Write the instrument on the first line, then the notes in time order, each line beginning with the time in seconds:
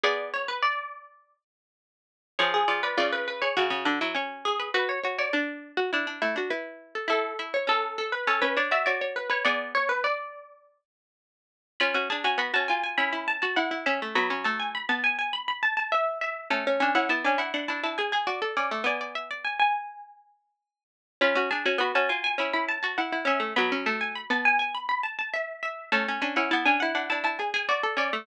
pizzicato strings
0.04 B3 G#4 D5
0.34 C#5
0.48 B4
0.62 D5
2.39 F3 G#4 C#5
2.54 G#4
2.68 F3 D5
2.83 B4 D5
2.97 C#3 F4 D5
3.12 B4
3.28 B4
3.42 G#4 C#5
3.57 C#3 F#4
3.70 C#3
3.85 D3 D4
4.01 F#3 E4
4.15 C#4 C#5
4.45 G#4
4.60 B4
4.74 F#4 B4
4.89 C#5
5.04 F#4 C#5
5.19 C#5 D5
5.33 D4 D5
5.77 F#4
5.93 D4 E4
6.07 D4
6.22 A3 E4
6.36 D4 F#4
6.50 E4 B4
6.95 A4
7.08 E4 A4 E5
7.39 E4 E5
7.54 C#5
7.67 C#4 A4
7.98 A4
8.12 B4
8.27 C#4 A4 C#5
8.42 C#4 B4 C#5
8.57 D4 C#5 D5
8.71 F#4 D5 E5
8.86 F#4 C#5 D5
9.01 C#5
9.16 B4
9.30 B4 C#5
9.45 B3 G#4 D5
9.75 C#5
9.89 B4
10.04 D5
11.80 C#4 F4 B5
11.94 C#4 F#4
12.10 D4 G#4 A5
12.24 C#4 F#4 G#5
12.38 B3 F#4 B5
12.54 C#4 F#4 A5
12.68 F4 G#5
12.84 G#5
12.98 C#4 E4 B5
13.13 E4 B5
13.28 A5
13.42 F#4 A5
13.56 E4 F#5
13.71 E4
13.86 C#4 E5
14.02 A3
14.15 F#3 B3 B5
14.30 C#4
14.44 A3 A5
14.60 G#5
14.75 B5
14.89 B3 A5
15.04 G#5
15.19 G#5
15.33 B5
15.48 B5
15.63 A5
15.77 A5
15.92 E5
16.21 E5
16.50 A3 C#4 A5
16.67 C#4
16.80 C#4 D4 G#5
16.95 C#4 E4 F#5
17.09 B3 E4 A5
17.24 C#4 D4 G#5
17.38 E4 F#5
17.54 D4 F#5
17.68 D4 E4 A5
17.83 E4 A5
17.98 G#4 G#5
18.12 G#4 G#5
18.27 F#4 D5
18.42 A4
18.57 C#4 D5
18.71 A3
18.84 B3 D5 G#5
19.01 D5
19.15 E5
19.31 D5
19.45 G#5
19.60 G#5
21.21 C#4 F4 B5
21.35 C#4 F#4
21.51 D4 G#4 A5
21.66 C#4 F#4 G#5
21.78 B3 F#4 B5
21.95 C#4 F#4 A5
22.09 F4 G#5
22.24 G#5
22.38 C#4 E4 B5
22.53 E4 B5
22.69 A5
22.83 F#4 A5
22.98 E4 F#5
23.12 E4
23.25 C#4 E5
23.40 A3
23.56 F#3 B3 B5
23.72 C#4
23.86 A3 A5
24.01 G#5
24.15 B5
24.30 B3 A5
24.45 G#5
24.59 G#5
24.75 B5
24.89 B5
25.03 A5
25.19 A5
25.34 E5
25.63 E5
25.92 A3 C#4 A5
26.08 C#4
26.22 C#4 D4 G#5
26.36 C#4 E4 F#5
26.51 B3 E4 A5
26.66 C#4 D4 G#5
26.80 E4 F#5
26.95 D4 F#5
27.10 D4 E4 A5
27.24 E4 A5
27.39 G#4 G#5
27.54 G#4 G#5
27.69 F#4 D5
27.83 A4
27.97 C#4 D5
28.13 A3